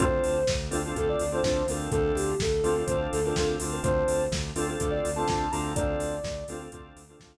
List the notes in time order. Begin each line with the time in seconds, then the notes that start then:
0.00 D2 C4 D4 F4 A4 C5, kick, closed hi-hat
0.24 D2, open hi-hat
0.47 D2, kick, snare
0.71 D2 C4 D4 F4 A4, open hi-hat
0.85 C4 D4 F4 A4
0.95 D2 C4 D4 F4 A4, kick, closed hi-hat
1.09 D5
1.19 D2, open hi-hat
1.32 C4 D4 F4 A4 C5
1.43 D2 C4 D4 F4 A4 C5, kick, snare
1.68 D2 C4 D4 F4 A4 A#4, open hi-hat
1.92 D2 C4 D4 F4 A4, kick, closed hi-hat
2.15 D2 G4, open hi-hat
2.40 D2 A4, kick, snare
2.64 D2 C4 D4 F4 A4, open hi-hat
2.76 C4 D4 F4 A4
2.86 D2 C4 D4 F4 A4 C5, kick, closed hi-hat
3.13 D2 A4, open hi-hat
3.25 C4 D4 F4 A4 A#4
3.36 D2 C4 D4 F4 A4, kick, snare
3.60 D2 C4 D4 F4 A4, open hi-hat
3.72 A#4
3.83 D2 C4 D4 F4 A4 C5, kick, closed hi-hat
4.08 D2, open hi-hat
4.32 D2, kick, snare
4.55 D2 C4 D4 F4 A4, open hi-hat
4.68 C4 D4 F4 A4
4.79 D2 C4 D4 F4 A4, kick, closed hi-hat
4.91 D5
5.04 D2, open hi-hat
5.16 C4 D4 F4 A4 A5
5.27 D2 C4 D4 F4 A4 A5, kick, snare
5.52 D2 C4 D4 F4 A4 A#5, open hi-hat
5.75 D2 C4 D4 F4 A4 D5, kick, closed hi-hat
5.99 D2, open hi-hat
6.24 D2, kick, snare
6.48 D2 C4 D4 F4 A4, open hi-hat
6.59 C4 D4 F4 A4
6.72 D2 C4 D4 F4 A4, kick, closed hi-hat
6.96 D2, open hi-hat
7.09 C4 D4 F4 A4
7.20 D2 C4 D4 F4 A4, kick, snare